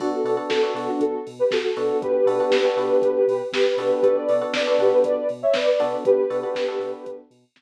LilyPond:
<<
  \new Staff \with { instrumentName = "Ocarina" } { \time 4/4 \key b \minor \tempo 4 = 119 <d' fis'>16 <fis' a'>8 r16 <fis' a'>8 <fis' a'>16 <d' fis'>16 <fis' a'>8 r16 <g' b'>16 <fis' a'>16 <fis' a'>8. | <g' b'>2. <g' b'>4 | <g' b'>16 <b' d''>8 r16 <b' d''>8 <g' b'>16 <g' b'>16 <b' d''>8 r16 <cis'' e''>16 <b' d''>16 <b' d''>8. | <g' b'>2~ <g' b'>8 r4. | }
  \new Staff \with { instrumentName = "Electric Piano 1" } { \time 4/4 \key b \minor <b d' fis' a'>8 <b d' fis' a'>16 <b d' fis' a'>8 <b d' fis' a'>16 <b d' fis' a'>2 <b d' fis' a'>8~ | <b d' fis' a'>8 <b d' fis' a'>16 <b d' fis' a'>8 <b d' fis' a'>16 <b d' fis' a'>2 <b d' fis' a'>8 | <b d' fis' a'>8 <b d' fis' a'>16 <b d' fis' a'>8 <b d' fis' a'>16 <b d' fis' a'>2 <b d' fis' a'>8~ | <b d' fis' a'>8 <b d' fis' a'>16 <b d' fis' a'>8 <b d' fis' a'>16 <b d' fis' a'>2 r8 | }
  \new Staff \with { instrumentName = "Synth Bass 2" } { \clef bass \time 4/4 \key b \minor b,,8 b,8 b,,8 b,8 b,,8 b,8 b,,8 b,8 | b,,8 b,8 b,,8 b,8 b,,8 b,8 b,,8 b,8 | b,,8 b,8 b,,8 b,8 b,,8 b,8 b,,8 b,8 | b,,8 b,8 b,,8 b,8 b,,8 b,8 b,,8 r8 | }
  \new DrumStaff \with { instrumentName = "Drums" } \drummode { \time 4/4 <cymc bd>8 hho8 <bd sn>8 hho8 <hh bd>8 hho8 <bd sn>8 hho8 | <hh bd>8 hho8 <bd sn>8 hho8 <hh bd>8 hho8 <bd sn>8 hho8 | <hh bd>8 hho8 <bd sn>8 hho8 <hh bd>8 hho8 <bd sn>8 hho8 | <hh bd>8 hho8 <bd sn>8 hho8 <hh bd>8 hho8 <bd sn>4 | }
>>